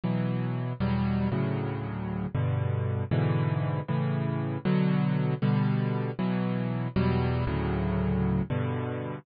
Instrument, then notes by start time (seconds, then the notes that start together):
acoustic grand piano
0.04 B2 E3 F#3
0.80 E2 B2 F#3 G3
1.32 D2 A2 C#3 F#3
2.35 G2 B2 D3
3.11 G#2 B2 D3 E3
3.88 A2 C#3 E3
4.65 B2 D3 F#3
5.42 B2 D3 G3
6.19 B2 E3 F#3
6.96 E2 B2 F#3 G3
7.47 D2 A2 C#3 F#3
8.50 G2 B2 D3